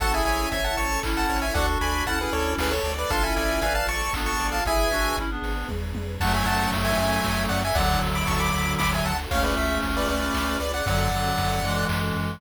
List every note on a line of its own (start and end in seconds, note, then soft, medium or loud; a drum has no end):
0.00 0.22 A1 loud
0.00 1.53 C#4 medium
0.00 1.53 E4 medium
0.00 0.12 F#4 medium
0.00 0.12 A4 medium
0.00 0.23 A4 loud
0.00 1.53 A4 medium
0.00 0.13 F#5 medium
0.00 0.13 A5 loud
0.00 kick medium
0.00 closed hi-hat medium
0.13 0.47 E4 medium
0.13 0.47 G#4 medium
0.13 0.24 E5 medium
0.13 0.24 G#5 medium
0.25 0.47 A1 loud
0.25 0.49 C#5 medium
0.25 0.49 E5 medium
0.25 0.49 G#5 medium
0.25 open hi-hat medium
0.52 0.75 A1 medium
0.52 0.75 C#5 medium
0.52 0.75 E5 medium
0.52 0.64 E5 medium
0.52 0.75 E5 medium
0.52 0.64 G#5 medium
0.52 kick medium
0.52 closed hi-hat medium
0.64 0.77 F#5 medium
0.64 0.77 A5 medium
0.77 0.99 A1 medium
0.77 1.01 C#5 medium
0.77 1.00 A5 medium
0.77 1.00 C#6 medium
0.77 open hi-hat medium
1.03 1.26 A1 medium
1.03 1.46 C#4 medium
1.03 1.46 E4 medium
1.03 1.27 A4 medium
1.03 kick medium
1.03 clap medium
1.17 1.38 F#5 medium
1.17 1.38 A5 medium
1.29 1.52 A1 medium
1.29 1.53 C#5 medium
1.29 open hi-hat medium
1.42 1.54 E5 medium
1.42 1.54 G#5 medium
1.54 1.77 D2 loud
1.54 3.08 D4 medium
1.54 2.05 D4 medium
1.54 3.08 F#4 medium
1.54 2.05 F#4 medium
1.54 3.08 A4 loud
1.54 1.78 A4 loud
1.54 1.66 D5 medium
1.54 1.66 F#5 medium
1.54 kick medium
1.54 closed hi-hat medium
1.81 2.03 D2 loud
1.81 2.04 D5 medium
1.81 2.04 G#5 medium
1.81 2.04 B5 medium
1.81 open hi-hat medium
2.06 2.28 D2 medium
2.06 2.19 C#4 medium
2.06 2.19 E4 medium
2.06 2.19 F#5 medium
2.06 2.30 F#5 medium
2.06 2.19 A5 medium
2.06 kick medium
2.06 closed hi-hat medium
2.20 2.72 C#4 medium
2.20 2.72 E4 medium
2.20 2.33 G#4 medium
2.20 2.33 B4 medium
2.33 2.55 D2 medium
2.33 2.54 A4 medium
2.33 2.54 C#5 medium
2.33 2.56 D5 medium
2.33 open hi-hat medium
2.58 2.80 D2 medium
2.58 2.73 G#4 medium
2.58 2.82 A4 medium
2.58 2.73 B4 medium
2.58 kick medium
2.58 snare medium
2.71 2.92 A4 medium
2.71 2.92 C#5 medium
2.83 3.05 D2 medium
2.83 3.08 D5 medium
2.83 open hi-hat medium
2.98 3.11 B4 medium
2.98 3.11 D5 medium
3.10 3.33 A1 medium
3.10 4.63 D4 medium
3.10 3.23 D4 medium
3.10 4.63 F4 medium
3.10 3.23 F4 medium
3.10 4.63 A4 loud
3.10 3.34 A4 loud
3.10 3.23 F5 medium
3.10 3.23 A5 medium
3.10 kick medium
3.10 closed hi-hat medium
3.23 3.61 C#4 medium
3.23 3.61 E4 medium
3.23 3.35 E5 medium
3.23 3.35 G#5 medium
3.36 3.59 A1 medium
3.36 3.59 D5 medium
3.36 3.60 E5 medium
3.36 3.60 G#5 medium
3.36 open hi-hat medium
3.61 3.84 A1 loud
3.61 3.86 B4 medium
3.61 3.86 D5 medium
3.61 3.74 E5 medium
3.61 3.85 F5 medium
3.61 3.74 G#5 medium
3.61 kick medium
3.61 closed hi-hat medium
3.75 3.87 F5 medium
3.75 3.87 A5 medium
3.87 4.09 A1 medium
3.87 4.11 D5 medium
3.87 4.13 A5 medium
3.87 4.13 C#6 medium
3.87 open hi-hat medium
4.13 4.36 A1 medium
4.13 4.59 B3 medium
4.13 4.59 D4 medium
4.13 4.37 A4 medium
4.13 kick medium
4.13 clap medium
4.26 4.47 A5 medium
4.26 4.47 C#6 medium
4.39 4.61 A1 medium
4.39 4.63 D5 medium
4.39 open hi-hat medium
4.52 4.64 F5 medium
4.52 4.64 A5 medium
4.66 4.88 G#1 loud
4.66 6.19 D4 medium
4.66 4.90 E4 medium
4.66 6.19 G#4 medium
4.66 4.90 G#4 medium
4.66 6.19 B4 medium
4.66 5.17 E5 medium
4.66 5.17 G#5 loud
4.66 kick medium
4.66 closed hi-hat medium
4.91 5.13 G#1 medium
4.91 5.16 D4 medium
4.91 5.16 F#4 medium
4.91 open hi-hat medium
5.17 5.39 G#1 medium
5.17 5.30 C#4 medium
5.17 5.30 E4 medium
5.17 kick medium
5.17 closed hi-hat medium
5.30 5.68 B3 medium
5.30 5.68 D4 medium
5.42 5.64 G#1 loud
5.42 open hi-hat medium
5.69 5.93 E2 loud
5.69 kick medium
5.69 high tom medium
5.95 6.18 F2 medium
5.95 high tom medium
6.20 6.43 F#2 loud
6.20 7.62 F#3 medium
6.20 7.62 A3 medium
6.20 7.74 C#4 loud
6.20 7.74 F#4 loud
6.20 7.74 A4 medium
6.20 6.33 F#5 medium
6.20 6.33 A5 medium
6.20 kick medium
6.20 crash loud
6.34 6.47 E5 medium
6.34 6.47 G#5 medium
6.46 6.68 F#2 medium
6.46 6.71 F#5 medium
6.46 6.71 A5 medium
6.46 ride medium
6.72 6.94 F#2 medium
6.72 kick medium
6.72 ride medium
6.85 6.97 E5 medium
6.85 6.97 G#5 medium
6.97 7.20 F#2 medium
6.97 7.44 E5 medium
6.97 7.44 G#5 medium
6.97 ride medium
7.24 7.47 F#2 medium
7.24 kick medium
7.24 snare medium
7.49 7.72 F#2 medium
7.49 7.61 D5 medium
7.49 7.61 F#5 medium
7.49 ride medium
7.65 7.77 E5 medium
7.65 7.77 G#5 medium
7.75 7.97 D2 loud
7.75 9.12 D3 medium
7.75 9.12 F#3 medium
7.75 9.29 D4 medium
7.75 9.29 F#4 loud
7.75 9.29 A4 medium
7.75 8.00 D5 medium
7.75 8.00 F#5 medium
7.75 kick medium
7.75 ride medium
8.02 8.24 D2 medium
8.02 ride medium
8.15 8.27 B5 medium
8.15 8.27 D6 medium
8.27 8.50 D2 medium
8.27 8.39 A5 medium
8.27 8.39 C#6 medium
8.27 kick medium
8.27 ride medium
8.40 8.73 B5 medium
8.40 8.73 D6 medium
8.53 8.76 D2 medium
8.53 ride medium
8.79 9.01 D2 medium
8.79 8.91 B5 medium
8.79 8.91 D6 medium
8.79 kick medium
8.79 snare medium
8.94 9.06 E5 medium
8.94 9.06 G#5 medium
9.05 9.27 D2 medium
9.05 9.18 F#5 medium
9.05 9.18 A5 medium
9.05 ride medium
9.31 9.53 C#2 loud
9.31 10.58 A3 medium
9.31 10.58 C#4 medium
9.31 10.85 C#4 loud
9.31 10.85 F4 medium
9.31 10.85 G#4 medium
9.31 9.43 C#5 medium
9.31 9.43 F5 medium
9.31 kick medium
9.31 ride medium
9.43 9.55 B4 medium
9.43 9.55 D5 medium
9.57 9.79 C#2 loud
9.57 9.79 E5 medium
9.57 ride medium
9.82 10.05 C#2 medium
9.82 kick medium
9.82 ride medium
9.97 10.08 B4 medium
9.97 10.08 D5 medium
10.08 10.31 C#2 medium
10.08 10.57 B4 medium
10.08 10.57 D5 medium
10.08 ride medium
10.34 10.57 C#2 medium
10.34 kick medium
10.34 clap medium
10.60 10.82 C#2 medium
10.60 10.72 B4 medium
10.60 10.72 D5 medium
10.60 ride medium
10.74 10.86 D5 medium
10.74 10.86 F#5 medium
10.86 11.09 F#2 loud
10.86 11.09 D3 medium
10.86 11.09 F#3 medium
10.86 12.40 C#4 medium
10.86 12.40 F#4 loud
10.86 12.40 A4 loud
10.86 11.85 D5 medium
10.86 11.85 F#5 medium
10.86 kick medium
10.86 ride medium
11.11 11.33 F#2 medium
11.11 11.60 D3 medium
11.11 11.60 F#3 medium
11.11 ride medium
11.38 11.60 F#2 medium
11.38 kick medium
11.38 ride medium
11.63 11.85 F#2 medium
11.63 12.40 E3 medium
11.63 12.40 G#3 medium
11.63 ride medium
11.89 12.12 F#2 loud
11.89 kick medium
11.89 clap loud
12.16 12.38 F#2 medium
12.16 ride medium